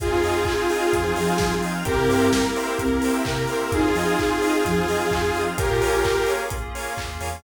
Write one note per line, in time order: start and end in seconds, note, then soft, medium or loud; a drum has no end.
0.00 0.09 F2 medium
0.00 1.84 C4 medium
0.00 1.84 D#4 medium
0.00 0.62 F4 medium
0.00 1.84 F4 medium
0.00 1.55 F4 medium
0.00 1.84 G#4 medium
0.00 1.55 G#4 medium
0.00 0.11 G#4 medium
0.00 0.08 C5 medium
0.00 0.08 D#5 medium
0.00 0.08 F5 medium
0.00 0.08 G#5 medium
0.00 kick loud
0.00 closed hi-hat loud
0.11 0.22 F2 medium
0.11 0.22 C5 medium
0.23 0.44 F2 medium
0.23 0.41 C5 medium
0.23 0.34 D#5 medium
0.23 0.41 D#5 medium
0.23 0.41 F5 medium
0.23 0.41 G#5 medium
0.23 open hi-hat medium
0.37 0.47 F5 medium
0.45 0.56 G#5 medium
0.45 kick medium
0.45 clap loud
0.59 0.69 C6 medium
0.69 0.89 F4 medium
0.69 0.86 C5 medium
0.69 0.86 D#5 medium
0.69 0.86 F5 medium
0.69 0.86 G#5 medium
0.69 0.81 D#6 medium
0.69 open hi-hat medium
0.82 0.92 F6 medium
0.93 1.14 F2 medium
0.93 1.12 F3 medium
0.93 1.04 G#4 medium
0.93 kick medium
0.93 closed hi-hat medium
1.04 1.14 C5 medium
1.16 1.83 F3 medium
1.16 1.33 C5 medium
1.16 1.33 D#5 medium
1.16 1.27 D#5 medium
1.16 1.33 F5 medium
1.16 1.33 G#5 medium
1.16 open hi-hat medium
1.28 1.39 F5 medium
1.38 1.61 F3 medium
1.38 1.50 G#5 medium
1.38 kick medium
1.38 snare loud
1.51 1.61 C6 medium
1.62 1.72 C5 medium
1.62 1.72 D#5 medium
1.62 1.72 F5 medium
1.62 1.72 G#5 medium
1.62 1.72 D#6 medium
1.62 open hi-hat medium
1.74 1.84 F6 medium
1.85 1.96 C2 medium
1.85 3.69 A#3 medium
1.85 3.69 C4 medium
1.85 2.65 C4 medium
1.85 3.69 E4 medium
1.85 3.69 G4 medium
1.85 1.96 G4 medium
1.85 2.29 G4 medium
1.85 1.93 A#4 medium
1.85 2.29 A#4 medium
1.85 1.93 C5 medium
1.85 1.93 E5 medium
1.85 1.93 G5 medium
1.85 kick medium
1.85 closed hi-hat loud
1.97 2.08 C3 medium
1.97 2.08 A#4 medium
2.09 2.30 G2 medium
2.09 2.26 A#4 medium
2.09 2.19 C5 medium
2.09 2.26 C5 medium
2.09 2.26 E5 medium
2.09 2.26 G5 medium
2.09 open hi-hat medium
2.20 2.31 E5 medium
2.32 3.16 A#4 medium
2.32 2.43 G5 medium
2.32 kick medium
2.32 snare loud
2.43 2.53 A#5 medium
2.56 2.73 A#4 medium
2.56 2.73 C5 medium
2.56 2.73 E5 medium
2.56 2.73 G5 medium
2.56 2.66 C6 medium
2.56 open hi-hat medium
2.67 2.78 E6 medium
2.77 3.00 C2 medium
2.77 3.22 C4 medium
2.77 2.88 G4 medium
2.77 kick medium
2.77 closed hi-hat medium
2.91 3.02 A#4 medium
3.02 3.21 A#4 medium
3.02 3.13 C5 medium
3.02 3.21 C5 medium
3.02 3.21 E5 medium
3.02 3.21 G5 medium
3.02 open hi-hat medium
3.13 3.23 E5 medium
3.25 3.46 C3 medium
3.25 3.72 A#4 medium
3.25 3.37 G5 medium
3.25 kick medium
3.25 clap loud
3.36 3.47 A#5 medium
3.47 3.57 A#4 medium
3.47 3.57 C5 medium
3.47 3.57 E5 medium
3.47 3.57 G5 medium
3.47 3.59 C6 medium
3.47 open hi-hat medium
3.61 3.71 E6 medium
3.72 3.82 F2 medium
3.72 5.56 C4 medium
3.72 5.56 D#4 medium
3.72 4.38 D#4 medium
3.72 5.56 F4 medium
3.72 5.40 F4 medium
3.72 5.56 G#4 medium
3.72 5.40 G#4 medium
3.72 3.83 G#4 medium
3.72 3.80 C5 medium
3.72 3.80 D#5 medium
3.72 3.80 F5 medium
3.72 3.80 G#5 medium
3.72 kick medium
3.72 closed hi-hat medium
3.84 3.94 F2 medium
3.84 3.94 C5 medium
3.95 4.16 F3 medium
3.95 4.12 C5 medium
3.95 4.12 D#5 medium
3.95 4.06 D#5 medium
3.95 4.12 F5 medium
3.95 4.12 G#5 medium
3.95 open hi-hat medium
4.07 4.17 F5 medium
4.17 4.27 G#5 medium
4.17 kick medium
4.17 clap medium
4.30 4.41 C6 medium
4.41 4.61 D#4 medium
4.41 4.58 C5 medium
4.41 4.58 D#5 medium
4.41 4.58 F5 medium
4.41 4.58 G#5 medium
4.41 4.52 D#6 medium
4.41 open hi-hat medium
4.54 4.64 F6 medium
4.65 4.86 F2 medium
4.65 4.84 F3 medium
4.65 4.75 G#4 medium
4.65 kick medium
4.65 closed hi-hat medium
4.76 4.87 C5 medium
4.87 5.53 F3 medium
4.87 5.04 C5 medium
4.87 4.98 D#5 medium
4.87 5.04 D#5 medium
4.87 5.04 F5 medium
4.87 5.04 G#5 medium
4.87 open hi-hat medium
5.00 5.11 F5 medium
5.11 5.32 F2 medium
5.11 5.22 G#5 medium
5.11 kick medium
5.11 clap loud
5.23 5.34 C6 medium
5.35 5.44 C5 medium
5.35 5.44 D#5 medium
5.35 5.44 F5 medium
5.35 5.44 G#5 medium
5.35 5.46 D#6 medium
5.35 open hi-hat medium
5.47 5.57 F6 medium
5.57 5.68 A#1 medium
5.57 7.43 A#3 medium
5.57 7.43 C#4 medium
5.57 5.81 F4 medium
5.57 7.43 F4 medium
5.57 6.32 G4 medium
5.57 7.43 G#4 medium
5.57 6.32 A#4 medium
5.57 5.66 A#4 medium
5.57 5.66 C#5 medium
5.57 5.66 F5 medium
5.57 5.66 G#5 medium
5.57 kick loud
5.57 closed hi-hat loud
5.71 5.81 A#2 medium
5.81 6.03 A#1 medium
5.81 6.19 F4 medium
5.81 5.98 A#4 medium
5.81 5.98 C#5 medium
5.81 5.98 F5 medium
5.81 5.98 G#5 medium
5.81 open hi-hat medium
6.04 kick medium
6.04 clap loud
6.26 6.43 A#4 medium
6.26 6.43 C#5 medium
6.26 6.43 F5 medium
6.26 6.43 G#5 medium
6.26 open hi-hat medium
6.50 6.72 A#1 medium
6.50 kick medium
6.50 closed hi-hat loud
6.75 6.91 A#4 medium
6.75 6.91 C#5 medium
6.75 6.91 F5 medium
6.75 6.91 G#5 medium
6.75 open hi-hat medium
6.97 7.19 D#2 soft
6.97 kick medium
6.97 clap loud
7.21 7.42 E2 medium
7.21 7.29 A#4 medium
7.21 7.29 C#5 medium
7.21 7.29 F5 medium
7.21 7.29 G#5 medium
7.21 open hi-hat medium